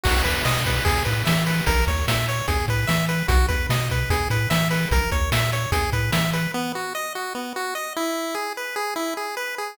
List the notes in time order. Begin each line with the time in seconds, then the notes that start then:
0.04 B1 F#4, kick, crash
0.24 E2 B4, kick, closed hi-hat
0.45 B2 D#5, snare
0.66 B4, kick, closed hi-hat
0.85 E2 G#4, kick, closed hi-hat
1.05 A2 B4, closed hi-hat
1.25 E3 E5, snare
1.46 B4, open hi-hat
1.66 A#1 A#4, kick, closed hi-hat
1.87 D#2 C#5, kick, closed hi-hat
2.08 A#2 E5, snare
2.28 C#5, closed hi-hat
2.48 E2 G#4, kick, closed hi-hat
2.68 A2 B4, kick, closed hi-hat
2.87 E3 E5, snare
3.09 B4, closed hi-hat
3.28 B1 F#4, kick, closed hi-hat
3.48 E2 B4, kick, closed hi-hat
3.69 B2 D#5, snare
3.90 B4, kick, closed hi-hat
4.10 E2 G#4, kick, closed hi-hat
4.30 A2 B4, closed hi-hat
4.50 E3 E5, snare
4.71 B4, open hi-hat
4.91 A#1 A#4, kick, closed hi-hat
5.12 D#2 C#5, kick, closed hi-hat
5.32 A#2 E5, snare
5.52 C#5, closed hi-hat
5.72 E2 G#4, kick, closed hi-hat
5.92 A2 B4, kick, closed hi-hat
6.12 E3 E5, snare
6.33 B4, closed hi-hat
6.54 B3
6.75 F#4
6.95 D#5
7.15 F#4
7.35 B3
7.56 F#4
7.75 D#5
7.96 E4
8.35 G#4
8.57 B4
8.76 G#4
8.96 E4
9.17 G#4
9.37 B4
9.58 G#4